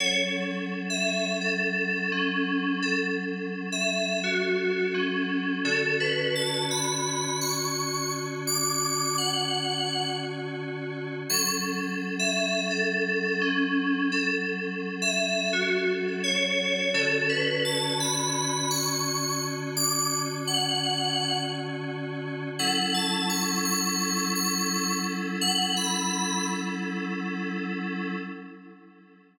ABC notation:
X:1
M:4/4
L:1/16
Q:"Swing 16ths" 1/4=85
K:F#m
V:1 name="Electric Piano 2"
c z4 e3 A4 C4 | A z4 e3 F4 C4 | A2 B2 a2 b4 c'4 z2 | d'4 f6 z6 |
c' z4 e3 A4 C4 | A z4 e3 F2 z2 c4 | A2 B2 a2 b4 c'4 z2 | d'2 z2 f6 z6 |
f2 a2 c'2 c'4 c'4 z2 | f f b4 z10 |]
V:2 name="Electric Piano 2"
[F,CA]16- | [F,CA]16 | [D,CF]16- | [D,CF]16 |
[F,CA]16- | [F,CA]16 | [D,CF]16- | [D,CF]16 |
[F,CEA]16- | [F,CEA]16 |]